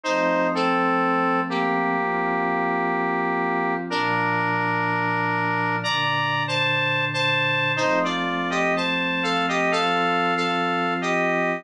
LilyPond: <<
  \new Staff \with { instrumentName = "Lead 1 (square)" } { \time 4/4 \key bes \major \tempo 4 = 62 <ees' c''>8 <c' a'>4 <bes g'>2~ <bes g'>8 | <d' bes'>2 \tuplet 3/2 { <d'' bes''>4 <c'' a''>4 <c'' a''>4 } | <ees' c''>16 <f' d''>8 <g' ees''>16 <c'' a''>8 <a' f''>16 <g' ees''>16 \tuplet 3/2 { <a' f''>4 <a' f''>4 <g' ees''>4 } | }
  \new Staff \with { instrumentName = "Pad 5 (bowed)" } { \time 4/4 \key bes \major <f a c'>2 <f c' f'>2 | <bes, f d'>2 <bes, d d'>2 | <f a c'>2 <f c' f'>2 | }
>>